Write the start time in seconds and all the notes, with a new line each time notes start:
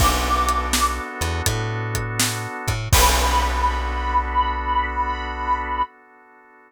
0.00 B1 B3 D4 F#4 A4 D6, kick, crash
0.48 closed hi-hat
0.73 snare
1.21 E2, closed hi-hat
1.46 A2, kick, closed hi-hat
1.95 kick, closed hi-hat
2.20 snare
2.68 A2, kick, closed hi-hat
2.93 B1 B3 D4 F#4 A4 B5, kick, crash